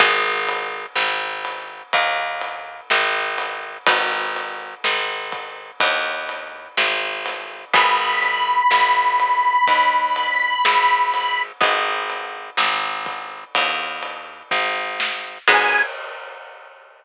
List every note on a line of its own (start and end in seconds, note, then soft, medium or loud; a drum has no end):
0.00 0.86 G#1 loud
0.00 3.48 B3 loud
0.00 3.48 D#4 loud
0.00 3.48 F#4 loud
0.00 3.48 G#4 loud
0.00 kick loud
0.00 ride loud
0.49 ride medium
0.95 1.82 G#1 medium
0.95 snare loud
1.45 ride medium
1.93 2.81 D#2 medium
1.93 kick medium
1.93 ride loud
2.41 ride medium
2.90 3.78 G#1 medium
2.90 snare loud
3.38 snare medium
3.38 ride medium
3.86 4.75 G#1 medium
3.86 7.35 B3 medium
3.86 7.35 D#4 medium
3.86 7.35 F#4 medium
3.86 7.35 G#4 medium
3.86 kick loud
3.86 ride loud
4.36 ride medium
4.84 5.71 G#1 medium
4.84 snare loud
5.32 kick medium
5.32 ride medium
5.80 6.68 D#2 medium
5.80 kick loud
5.80 ride loud
6.29 ride medium
6.77 7.65 G#1 medium
6.77 snare loud
7.26 snare medium
7.26 ride medium
7.74 8.62 G#1 loud
7.74 11.22 B3 loud
7.74 11.22 D#4 medium
7.74 11.22 F#4 medium
7.74 11.22 G#4 loud
7.74 11.42 B5 medium
7.74 kick loud
7.74 ride loud
8.22 ride medium
8.71 9.58 G#1 medium
8.71 snare loud
9.20 ride medium
9.67 10.55 D#2 medium
9.67 kick medium
9.67 ride loud
10.16 ride medium
10.65 11.52 G#1 medium
10.65 snare loud
11.14 snare medium
11.14 ride medium
11.61 12.50 G#1 medium
11.61 15.09 B3 medium
11.61 15.09 D#4 medium
11.61 15.09 F#4 medium
11.61 15.09 G#4 medium
11.61 kick loud
11.61 ride loud
12.10 ride medium
12.57 13.44 G#1 medium
12.57 snare loud
13.06 kick medium
13.06 ride medium
13.55 14.43 D#2 medium
13.55 kick loud
13.55 ride loud
14.03 ride medium
14.51 15.38 G#1 medium
14.51 kick loud
14.51 snare medium
15.00 snare loud
15.48 15.82 G#2 loud
15.48 15.81 B3 loud
15.48 15.81 D#4 medium
15.48 15.81 F#4 loud
15.48 15.81 G#4 loud
15.48 15.82 G#5 loud
15.48 kick loud
15.48 crash loud